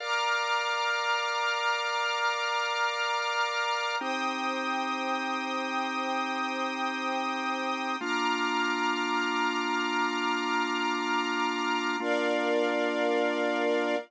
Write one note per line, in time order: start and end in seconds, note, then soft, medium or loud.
0.00 3.96 A#4 loud
0.00 3.96 D5 medium
0.00 3.96 F5 medium
0.00 3.95 A#5 medium
0.00 3.95 D6 medium
0.00 3.95 F6 medium
4.00 7.97 C4 loud
4.00 7.97 D#4 loud
4.00 7.97 G4 medium
4.00 7.96 C5 medium
4.00 7.96 G5 medium
4.00 7.96 D#6 medium
8.00 11.97 A#3 loud
8.00 11.97 D4 medium
8.00 11.97 F4 loud
8.00 11.96 A#5 medium
8.00 11.96 D6 medium
8.00 11.96 F6 medium
12.00 13.96 A#3 loud
12.00 13.96 D4 loud
12.00 13.96 F4 loud
12.00 13.96 A#4 loud
12.00 13.96 D5 loud
12.00 13.96 F5 loud